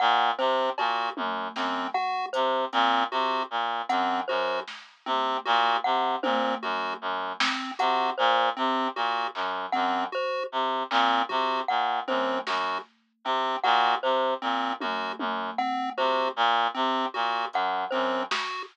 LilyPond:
<<
  \new Staff \with { instrumentName = "Clarinet" } { \clef bass \time 6/4 \tempo 4 = 77 bes,8 c8 bes,8 ges,8 ges,8 r8 c8 bes,8 c8 bes,8 ges,8 ges,8 | r8 c8 bes,8 c8 bes,8 ges,8 ges,8 r8 c8 bes,8 c8 bes,8 | ges,8 ges,8 r8 c8 bes,8 c8 bes,8 ges,8 ges,8 r8 c8 bes,8 | c8 bes,8 ges,8 ges,8 r8 c8 bes,8 c8 bes,8 ges,8 ges,8 r8 | }
  \new Staff \with { instrumentName = "Lead 1 (square)" } { \time 6/4 r8 c'8 ges'8 r8 c'8 ges'8 r8 c'8 ges'8 r8 c'8 ges'8 | r8 c'8 ges'8 r8 c'8 ges'8 r8 c'8 ges'8 r8 c'8 ges'8 | r8 c'8 ges'8 r8 c'8 ges'8 r8 c'8 ges'8 r8 c'8 ges'8 | r8 c'8 ges'8 r8 c'8 ges'8 r8 c'8 ges'8 r8 c'8 ges'8 | }
  \new Staff \with { instrumentName = "Glockenspiel" } { \time 6/4 ges''8 c''8 r4. ges''8 c''8 r4. ges''8 c''8 | r4. ges''8 c''8 r4. ges''8 c''8 r4 | r8 ges''8 c''8 r4. ges''8 c''8 r4. ges''8 | c''8 r4. ges''8 c''8 r4. ges''8 c''8 r8 | }
  \new DrumStaff \with { instrumentName = "Drums" } \drummode { \time 6/4 r4 cb8 tommh8 sn4 hh8 hh8 r4 hh4 | sn8 tommh8 r4 tommh4 r8 sn8 hh4 r4 | hc8 bd8 r4 hc8 bd8 r8 tommh8 sn4 r4 | r4 tommh8 tommh8 r8 tomfh8 r4 r8 hh8 r8 sn8 | }
>>